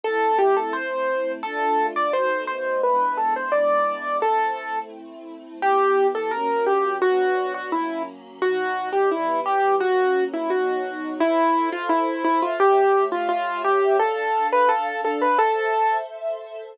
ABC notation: X:1
M:2/4
L:1/16
Q:1/4=86
K:Am
V:1 name="Acoustic Grand Piano"
A2 G A c4 | A3 d c2 c2 | B2 A c d4 | A4 z4 |
[K:Em] G3 A ^A2 G2 | F3 F E2 z2 | F3 G E2 G2 | F3 E F4 |
[K:Am] E3 F E2 E F | G3 F F2 G2 | A3 B A2 A B | A4 z4 |]
V:2 name="String Ensemble 1"
[A,CE]8 | [A,DF]4 [B,,A,^D^F]4 | [^G,B,DE]8 | [A,CE]8 |
[K:Em] [E,B,G]4 [F,^A,^C]4 | [F,B,D]4 [F,^A,^C]4 | [B,,F,^D]4 [E,G,B,]4 | [F,^A,^C]4 [B,,F,^D]4 |
[K:Am] [Ace]8 | [A,G^ce]8 | [DAf]8 | [Ace]8 |]